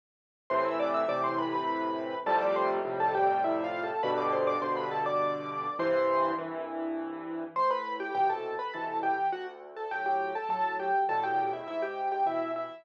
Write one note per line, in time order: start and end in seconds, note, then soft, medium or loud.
0.50 1.04 A2 loud
0.50 1.04 C3 medium
0.50 1.04 E3 loud
0.50 0.64 C5 medium
0.50 0.64 C6 medium
0.65 0.79 E5 medium
0.65 0.79 E6 medium
0.79 0.93 D5 medium
0.79 0.93 D6 medium
0.94 1.08 E5 medium
0.94 1.08 E6 medium
1.08 2.14 A2 medium
1.08 2.14 C3 medium
1.08 2.14 E3 medium
1.08 1.23 D5 medium
1.08 1.23 D6 medium
1.24 1.37 C5 medium
1.24 1.37 C6 medium
1.38 1.52 B4 medium
1.38 1.52 B5 medium
1.53 2.18 B4 medium
1.53 2.18 B5 medium
2.26 2.79 F2 loud
2.26 2.79 A2 loud
2.26 2.79 C3 loud
2.26 2.79 G3 loud
2.26 2.40 A4 medium
2.26 2.40 A5 loud
2.41 2.55 D5 medium
2.41 2.55 D6 medium
2.56 2.70 C5 medium
2.56 2.70 C6 medium
2.85 3.91 F2 loud
2.85 3.91 A2 medium
2.85 3.91 C3 medium
2.85 3.91 G3 medium
3.00 3.14 A4 medium
3.00 3.14 A5 medium
3.15 3.41 G4 medium
3.15 3.41 G5 medium
3.44 3.63 E4 medium
3.44 3.63 E5 medium
3.64 3.82 F4 medium
3.64 3.82 F5 medium
3.83 4.02 A4 medium
3.83 4.02 A5 medium
4.03 4.56 G2 loud
4.03 4.56 B2 loud
4.03 4.56 D3 loud
4.03 4.17 B4 medium
4.03 4.17 B5 medium
4.18 4.32 D5 medium
4.18 4.32 D6 medium
4.32 4.46 C5 medium
4.32 4.46 C6 medium
4.47 4.61 D5 medium
4.47 4.61 D6 medium
4.61 5.67 G2 medium
4.61 5.67 B2 medium
4.61 5.67 D3 medium
4.61 4.76 C5 medium
4.61 4.76 C6 medium
4.77 4.91 B4 medium
4.77 4.91 B5 medium
4.91 5.05 A4 medium
4.91 5.05 A5 medium
5.06 5.74 D5 medium
5.06 5.74 D6 medium
5.79 6.32 C2 medium
5.79 6.32 G2 loud
5.79 6.32 E3 loud
5.79 6.32 C5 medium
5.79 6.32 C6 medium
6.38 7.44 C2 medium
6.38 7.44 G2 medium
6.38 7.44 E3 loud
7.56 8.09 A2 medium
7.56 7.70 C5 medium
7.56 7.70 C6 loud
7.71 7.95 B4 medium
7.71 7.95 B5 medium
8.00 8.14 G4 medium
8.00 8.14 G5 medium
8.15 8.56 B2 medium
8.15 8.56 C3 medium
8.15 8.56 E3 soft
8.15 8.29 G4 medium
8.15 8.29 G5 medium
8.30 8.55 A4 medium
8.30 8.55 A5 medium
8.59 8.73 B4 medium
8.59 8.73 B5 medium
8.74 9.16 B2 medium
8.74 9.16 C3 medium
8.74 9.16 E3 medium
8.74 8.98 A4 medium
8.74 8.98 A5 medium
9.03 9.28 G4 medium
9.03 9.28 G5 medium
9.32 9.85 D2 medium
9.32 9.46 F#4 medium
9.32 9.46 F#5 medium
9.76 9.90 A4 medium
9.76 9.90 A5 medium
9.91 10.33 A2 soft
9.91 10.33 F#3 medium
9.91 10.05 G4 medium
9.91 10.05 G5 medium
10.06 10.32 G4 medium
10.06 10.32 G5 medium
10.35 10.49 A4 medium
10.35 10.49 A5 medium
10.49 10.90 A2 medium
10.49 10.90 F#3 medium
10.49 10.75 A4 medium
10.49 10.75 A5 medium
10.79 11.04 G4 medium
10.79 11.04 G5 medium
11.09 11.62 E2 medium
11.09 11.62 A2 medium
11.09 11.62 B2 medium
11.09 11.23 A4 medium
11.09 11.23 A5 medium
11.23 11.49 G4 medium
11.23 11.49 G5 medium
11.53 11.67 E4 medium
11.53 11.67 E5 medium
11.67 12.20 G#2 medium
11.67 11.82 E4 medium
11.67 11.82 E5 medium
11.82 12.08 G4 medium
11.82 12.08 G5 medium
12.12 12.26 G4 medium
12.12 12.26 G5 medium
12.26 12.67 B2 medium
12.26 12.67 E3 medium
12.26 12.51 E4 medium
12.26 12.51 E5 medium
12.56 12.84 E4 medium
12.56 12.84 E5 medium